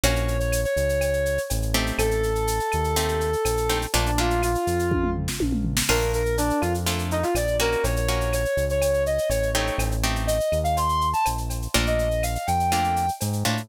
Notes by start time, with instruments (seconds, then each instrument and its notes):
0.03 synth bass 1 A#1, acoustic guitar (steel) A#3 C#4 F#4, brass section C#5, cowbell, shaker
0.16 shaker
0.28 shaker
0.39 brass section C#5, shaker
0.52 claves, shaker
0.65 brass section C#5, shaker
0.76 synth bass 1 C#2, shaker
0.89 shaker
1.01 cowbell, claves, shaker
1.13 shaker
1.26 shaker
1.38 shaker
1.50 synth bass 1 A1, cowbell, shaker
1.62 shaker
1.74 acoustic guitar (steel) A3 C4 D#4 G4, cowbell, shaker
1.86 shaker
1.98 synth bass 1 A1, brass section A4, cowbell, claves, shaker
2.11 shaker
2.23 shaker
2.35 shaker
2.47 shaker
2.60 shaker
2.72 synth bass 1 D#2, claves, shaker
2.84 shaker
2.96 acoustic guitar (steel) A3 C4 D#4 G4, cowbell, shaker
3.08 shaker
3.21 shaker
3.33 shaker
3.45 synth bass 1 A#1, cowbell, claves, shaker
3.57 shaker
3.69 acoustic guitar (steel) A3 C4 D#4 G4, cowbell, shaker
3.82 shaker
3.93 synth bass 1 A#1, acoustic guitar (steel) A3 A#3 D4 F4, brass section D4, cowbell, shaker
4.06 brass section D4, shaker
4.18 acoustic guitar (steel) A3 A#3 D4 F4, brass section F4, shaker
4.30 shaker
4.43 brass section F4, claves, shaker
4.55 shaker
4.67 synth bass 1 F2, shaker
4.79 shaker
4.91 kick, high tom
5.04 mid tom
5.16 floor tom
5.28 snare
5.40 synth bass 1 A#1, high tom
5.52 mid tom
5.65 floor tom
5.77 snare
5.89 synth bass 1 A#1, acoustic guitar (steel) A3 A#3 D4 F4, brass section A#4, crash, cowbell, claves
6.01 shaker
6.13 brass section A#4, shaker
6.26 shaker
6.38 brass section D4, shaker
6.50 shaker
6.61 synth bass 1 F2, brass section F4, claves, shaker
6.74 shaker
6.86 acoustic guitar (steel) A3 A#3 D4 F4, cowbell, shaker
6.99 shaker
7.11 brass section D#4, shaker
7.23 brass section F4, shaker
7.35 synth bass 1 A#1, brass section D5, cowbell, claves, shaker
7.47 shaker
7.60 acoustic guitar (steel) A#3 C#4 F#4, brass section A#4, cowbell, shaker
7.72 shaker
7.83 synth bass 1 A#1, brass section C#5, cowbell, shaker
7.96 brass section C#5, shaker
8.08 acoustic guitar (steel) A#3 C#4 F#4, shaker
8.21 shaker
8.33 brass section C#5, claves, shaker
8.45 shaker
8.57 synth bass 1 C#2, shaker
8.69 brass section C#5, shaker
8.82 cowbell, claves, shaker
8.94 shaker
9.06 brass section D#5, shaker
9.18 shaker
9.29 synth bass 1 A1, brass section C#5, cowbell, shaker
9.43 shaker
9.54 acoustic guitar (steel) A3 C4 D#4 G4, brass section C#5, cowbell, shaker
9.67 shaker
9.78 synth bass 1 A1, cowbell, claves, shaker
9.91 shaker
10.04 acoustic guitar (steel) A3 C4 D#4 G4, shaker
10.16 shaker
10.27 brass section D#5, shaker
10.40 shaker
10.52 synth bass 1 D#2, claves, shaker
10.64 brass section F5, shaker
10.77 brass section C6, cowbell, shaker
10.89 shaker
11.01 shaker
11.13 brass section A5, shaker
11.25 synth bass 1 A#1, cowbell, claves, shaker
11.38 shaker
11.50 cowbell, shaker
11.62 shaker
11.74 synth bass 1 A#1, acoustic guitar (steel) A3 A#3 D4 F4, brass section D5, cowbell, shaker
11.86 brass section D#5, shaker
11.99 shaker
12.11 shaker
12.23 brass section F5, claves, shaker
12.35 brass section F5, shaker
12.47 synth bass 1 F2, brass section G5, shaker
12.60 shaker
12.72 acoustic guitar (steel) A3 A#3 D4 F4, cowbell, claves, shaker
12.84 shaker
12.96 shaker
13.08 shaker
13.21 synth bass 1 G#2, cowbell, shaker
13.33 shaker
13.45 synth bass 1 A2, acoustic guitar (steel) A3 A#3 D4 F4, cowbell, shaker
13.57 shaker